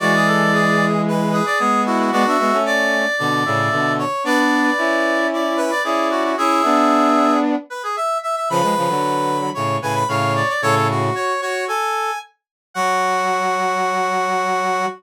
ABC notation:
X:1
M:4/4
L:1/16
Q:1/4=113
K:F#m
V:1 name="Brass Section"
d8 z2 B d G2 F F | F4 d10 z2 | d8 z2 B d G2 F F | G8 z2 B G e2 e e |
b8 z2 g b ^e2 d d | c c z2 c2 c2 g4 z4 | f16 |]
V:2 name="Brass Section"
F G A2 G4 B2 G4 E2 | d e e2 d4 d2 e4 c2 | B B7 d2 B2 d4 | e8 z8 |
B B7 c2 B2 c4 | A2 F4 F2 A4 z4 | F16 |]
V:3 name="Brass Section"
[E,G,]12 [G,B,]4 | [G,B,] [B,D] [G,B,] [A,C]5 [B,,D,]2 [A,,C,]2 [B,,D,]3 z | [B,D]4 [CE]8 [CE]4 | [CE]2 [B,D]8 z6 |
[C,^E,] [E,G,] [C,E,] [D,F,]5 [A,,C,]2 [A,,C,]2 [A,,C,]3 z | [A,,C,]4 z12 | F,16 |]